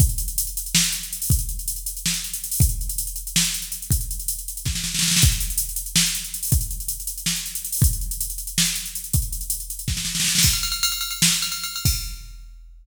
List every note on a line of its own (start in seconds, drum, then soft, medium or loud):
0.00 kick loud
0.00 closed hi-hat loud
0.09 closed hi-hat medium
0.18 closed hi-hat loud
0.28 closed hi-hat medium
0.38 closed hi-hat loud
0.47 closed hi-hat medium
0.57 closed hi-hat loud
0.66 closed hi-hat medium
0.75 snare loud
0.84 closed hi-hat medium
0.92 closed hi-hat medium
1.03 closed hi-hat medium
1.13 closed hi-hat loud
1.22 open hi-hat medium
1.30 kick loud
1.30 closed hi-hat loud
1.39 closed hi-hat medium
1.49 closed hi-hat medium
1.59 closed hi-hat medium
1.68 closed hi-hat loud
1.76 closed hi-hat medium
1.86 closed hi-hat loud
1.97 closed hi-hat medium
2.06 snare loud
2.14 closed hi-hat medium
2.24 closed hi-hat medium
2.33 closed hi-hat loud
2.44 closed hi-hat medium
2.51 open hi-hat medium
2.60 kick loud
2.60 closed hi-hat loud
2.69 closed hi-hat medium
2.81 closed hi-hat medium
2.89 closed hi-hat loud
2.98 closed hi-hat loud
3.07 closed hi-hat medium
3.16 closed hi-hat medium
3.27 closed hi-hat medium
3.36 snare loud
3.45 closed hi-hat medium
3.54 closed hi-hat medium
3.62 closed hi-hat medium
3.72 closed hi-hat medium
3.82 closed hi-hat medium
3.91 kick loud
3.91 closed hi-hat loud
4.01 closed hi-hat medium
4.11 closed hi-hat medium
4.19 closed hi-hat medium
4.28 closed hi-hat loud
4.39 closed hi-hat medium
4.48 closed hi-hat medium
4.57 closed hi-hat medium
4.65 kick medium
4.65 snare medium
4.75 snare medium
4.84 snare medium
4.94 snare medium
4.99 snare loud
5.02 snare medium
5.08 snare medium
5.11 snare loud
5.16 snare loud
5.22 kick loud
5.22 closed hi-hat loud
5.32 closed hi-hat medium
5.40 closed hi-hat loud
5.50 closed hi-hat medium
5.58 closed hi-hat loud
5.69 closed hi-hat medium
5.76 closed hi-hat loud
5.86 closed hi-hat medium
5.96 snare loud
6.06 closed hi-hat medium
6.15 closed hi-hat medium
6.24 closed hi-hat medium
6.34 closed hi-hat loud
6.43 open hi-hat medium
6.52 kick loud
6.52 closed hi-hat loud
6.61 closed hi-hat medium
6.71 closed hi-hat medium
6.80 closed hi-hat medium
6.88 closed hi-hat loud
7.00 closed hi-hat medium
7.07 closed hi-hat loud
7.18 closed hi-hat medium
7.26 snare loud
7.36 closed hi-hat medium
7.46 closed hi-hat medium
7.55 closed hi-hat loud
7.65 closed hi-hat medium
7.72 open hi-hat medium
7.82 kick loud
7.82 closed hi-hat loud
7.93 closed hi-hat medium
8.01 closed hi-hat medium
8.11 closed hi-hat loud
8.21 closed hi-hat loud
8.30 closed hi-hat medium
8.38 closed hi-hat medium
8.47 closed hi-hat medium
8.58 snare loud
8.65 closed hi-hat medium
8.75 closed hi-hat medium
8.86 closed hi-hat medium
8.95 closed hi-hat medium
9.04 closed hi-hat medium
9.13 kick loud
9.13 closed hi-hat loud
9.22 closed hi-hat medium
9.32 closed hi-hat medium
9.41 closed hi-hat medium
9.50 closed hi-hat loud
9.60 closed hi-hat medium
9.70 closed hi-hat medium
9.79 closed hi-hat medium
9.88 kick medium
9.88 snare medium
9.97 snare medium
10.05 snare medium
10.15 snare medium
10.20 snare loud
10.24 snare medium
10.28 snare medium
10.35 snare loud
10.38 snare loud
10.43 kick loud
10.43 crash loud
10.53 ride medium
10.63 ride loud
10.72 ride medium
10.83 ride loud
10.92 ride medium
11.01 ride medium
11.11 ride medium
11.22 snare loud
11.32 ride medium
11.42 ride medium
11.52 ride medium
11.64 ride medium
11.76 ride medium
11.85 kick loud
11.85 crash loud